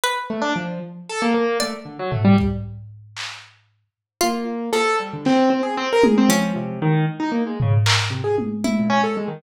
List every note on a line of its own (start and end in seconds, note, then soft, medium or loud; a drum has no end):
0.04 0.27 B4 loud
0.30 0.42 A3 medium
0.42 0.53 D4 loud
0.56 0.79 F3 medium
1.09 1.21 A4 loud
1.22 1.34 A#3 loud
1.34 1.58 A#3 loud
1.60 1.74 A3 medium
1.60 3.01 D5 loud
1.60 closed hi-hat medium
1.85 1.97 D3 medium
1.99 2.11 F#3 medium
2.11 2.23 A3 medium
2.11 floor tom medium
2.25 2.36 G3 loud
2.38 kick medium
3.17 clap medium
4.21 4.70 A#3 medium
4.21 4.44 F4 loud
4.73 6.14 F3 medium
4.73 4.96 A4 loud
5.00 5.11 G3 medium
5.13 5.25 D3 medium
5.25 5.49 C4 loud
5.25 clap medium
5.50 5.62 C4 medium
5.63 5.75 G#4 medium
5.77 5.89 C4 loud
5.93 6.04 A#4 loud
6.03 6.15 G#4 medium
6.03 high tom loud
6.18 6.29 C4 loud
6.29 6.52 F3 medium
6.29 7.71 C#4 loud
6.56 6.79 C3 medium
6.82 7.05 D#3 loud
7.20 7.31 D#4 medium
7.32 7.43 A#3 medium
7.47 7.58 G#3 medium
7.60 7.74 C#3 medium
7.60 floor tom loud
7.86 8.57 A#4 medium
7.86 clap loud
8.10 8.22 C3 medium
8.24 8.36 G#4 medium
8.38 high tom medium
8.64 9.35 E4 medium
8.64 high tom medium
8.79 8.91 A#2 medium
8.90 9.02 C#4 loud
9.03 9.15 A4 medium
9.17 9.29 G#3 medium
9.28 9.40 D#3 medium